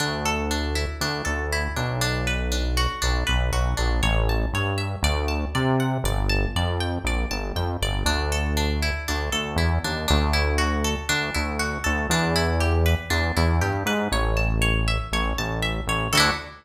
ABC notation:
X:1
M:4/4
L:1/8
Q:1/4=119
K:D
V:1 name="Synth Bass 1" clef=bass
D,,4 D,, D,,2 B,,,- | B,,,4 B,,, B,,, B,,, ^A,,, | A,,,2 G,,2 D,,2 =C,2 | G,,,2 =F,,2 ^A,,, G,,, F,, G,,, |
D,,4 D,, D,, E,, ^D,, | D,,4 D,, D,,2 D,, | E,,4 E,, E,, G,, ^G,, | A,,,4 A,,, A,,,2 A,,, |
D,,2 z6 |]
V:2 name="Acoustic Guitar (steel)"
D A D E D A E D | D B D F D B F D | c a c e d a d f | d a d g d a g d |
D A D E D A E D | D E F A D E F A | D E G B D E G B | c a c e c a e c |
[DEFA]2 z6 |]